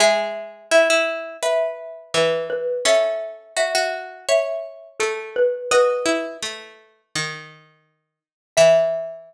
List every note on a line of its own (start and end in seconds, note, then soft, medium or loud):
0.00 2.10 G#3 medium
0.00 0.64 G#4 loud
0.00 0.65 E5 medium
0.71 0.88 E4 medium
0.71 1.35 E5 medium
0.90 1.37 E4 medium
1.43 2.63 B4 medium
1.43 2.10 E5 medium
2.14 2.80 E3 loud
2.14 2.45 B4 medium
2.50 2.84 B4 medium
2.85 4.75 C#4 loud
2.85 3.53 A4 medium
2.85 3.52 E5 medium
3.57 3.74 F#4 medium
3.57 4.17 E5 medium
3.75 4.26 F#4 medium
4.29 5.57 C#5 medium
4.29 4.87 E5 medium
5.00 5.67 A3 medium
5.00 5.29 A4 medium
5.36 5.70 B4 medium
5.71 6.06 F#4 loud
5.71 7.92 B4 loud
5.71 7.43 D#5 loud
6.06 6.37 E4 loud
6.42 7.01 A3 medium
7.15 8.20 D#3 loud
8.57 9.34 E3 loud
8.57 9.34 E5 loud